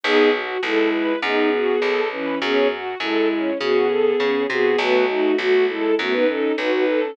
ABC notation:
X:1
M:4/4
L:1/16
Q:1/4=101
K:E
V:1 name="Violin"
[B,G]2 z2 [G,E]4 [B,G]6 [E,C]2 | [B,G]2 z2 [G,E]4 [B,G]6 [B,G]2 | [A,F]2 [A,F]2 [A,F]2 [G,E]2 [A,F] [DB] [CA]2 [DB] [DB]2 [CA] |]
V:2 name="String Ensemble 1"
D2 F2 A2 B2 D2 F2 A2 B2 | C2 F2 A2 C2 F2 A2 C2 F2 | B,2 D2 F2 A2 B,2 D2 F2 A2 |]
V:3 name="Electric Bass (finger)" clef=bass
B,,,4 B,,,4 F,,4 B,,,4 | F,,4 F,,4 C,4 C,2 =C,2 | B,,,4 B,,,4 F,,4 B,,,4 |]